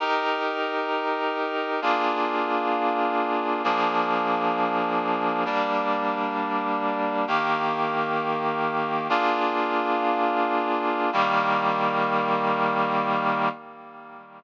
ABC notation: X:1
M:2/2
L:1/8
Q:1/2=66
K:Eb
V:1 name="Clarinet"
[EGB]8 | [B,DFA]8 | [F,B,DA]8 | [G,B,D]8 |
[E,B,G]8 | "^rit." [B,DFA]8 | [E,G,B,]8 |]